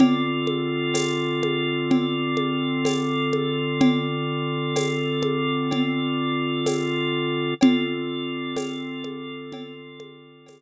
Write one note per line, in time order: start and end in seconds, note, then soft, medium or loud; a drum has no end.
0.00 7.54 D3 loud
0.00 7.54 C4 medium
0.00 7.54 F4 medium
0.00 7.54 A4 medium
0.00 cowbell medium
0.00 low conga medium
0.47 high conga medium
0.94 tambourine medium
0.94 cowbell medium
0.94 high conga medium
1.43 high conga medium
1.91 cowbell medium
1.91 low conga medium
2.37 high conga medium
2.85 tambourine medium
2.85 cowbell medium
2.85 high conga medium
3.33 high conga medium
3.81 cowbell medium
3.81 low conga medium
4.76 tambourine medium
4.76 cowbell medium
4.76 high conga medium
5.23 high conga medium
5.71 cowbell medium
5.71 low conga medium
6.66 tambourine medium
6.66 cowbell medium
6.66 high conga medium
7.61 10.62 D3 medium
7.61 10.62 C4 medium
7.61 10.62 F4 medium
7.61 10.62 A4 loud
7.61 cowbell medium
7.61 low conga loud
8.57 tambourine medium
8.57 cowbell medium
8.57 high conga medium
9.04 high conga medium
9.52 cowbell medium
9.52 low conga medium
10.00 high conga medium
10.46 tambourine medium
10.46 cowbell medium
10.46 high conga medium